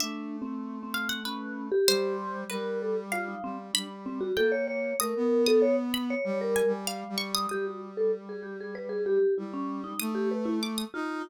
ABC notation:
X:1
M:6/4
L:1/16
Q:1/4=96
K:none
V:1 name="Vibraphone"
(3D4 C4 C4 ^C3 G3 z2 ^A2 =A z F ^D =C z | D z C ^F A ^c c2 ^A3 =A c z2 c c ^A2 z5 | G ^F z A z ^G =G ^G B G =G2 E ^C2 ^D2 G B E z2 =F2 |]
V:2 name="Brass Section"
A,12 G,4 G,6 G,2 | G,4 ^A,4 =A, B,7 (3G,4 G,4 G,4 | G,12 G,4 A,6 ^D2 |]
V:3 name="Orchestral Harp"
e6 f ^f B4 c4 B4 =f4 | b4 g4 ^d'3 d'3 b4 ^g2 f2 ^c' d' | ^d'16 d'4 =d' ^d'3 |]